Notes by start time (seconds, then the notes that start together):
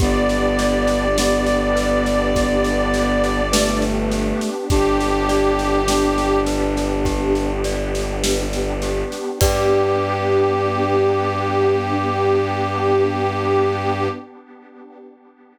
0.00 G1 B3 D4 G4 D5, kick, snare
0.29 snare
0.59 D5, snare
0.88 snare
1.17 B3 G4, snare
1.47 snare
1.75 B4, snare
2.06 snare
2.35 G4, kick, snare
2.64 snare
2.94 D5, snare
3.24 snare
3.52 A3 B4, snare
3.82 snare
4.12 G4, snare
4.41 snare
4.69 G1 B3 D4 G4, kick, snare
5.00 snare
5.28 D5, snare
5.59 snare
5.88 D4 G4, snare
6.18 snare
6.46 B4, snare
6.77 snare
7.05 G4, kick, snare
7.35 snare
7.64 D5, snare
7.95 snare
8.24 B4, snare
8.53 snare
8.82 G4, snare
9.12 snare
9.41 G2 B3 D4 G4 B4 D5, kick, crash